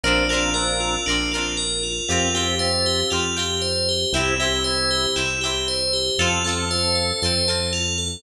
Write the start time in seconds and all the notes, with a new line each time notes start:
0.04 A#1 C4 D4 F4 A#4
0.29 C4 D4 F4 A#4
0.34 C4
0.54 C4 D4 F4 A#4
0.80 F4
1.06 A#1 D4 F4 A#4
1.11 C4
1.32 F4 A#4
1.36 C4 D4
1.57 A#4
1.83 F4
2.08 F2 C4 F4 G4
2.34 C4 F4 G4
2.59 C4 F4 G4 C5
2.86 G4
3.10 F2 C4 F4 G4
3.36 C4 F4 G4
3.62 C5
3.89 G4
4.13 C2 C4 E4 G4
4.39 C4 E4 G4
4.64 C4 E4 G4 C5
4.91 G4
5.16 C2 C4 E4 G4
5.41 E4 G4
5.46 C4
5.68 C5
5.93 G4
6.18 F2 C4 F4 A4
6.44 C4 F4 A4
6.70 C4 F4 A4 C5
6.95 A4
7.22 F2 C4 F4 A4 C5
7.48 C4 F4 A4
7.73 F4
7.98 A4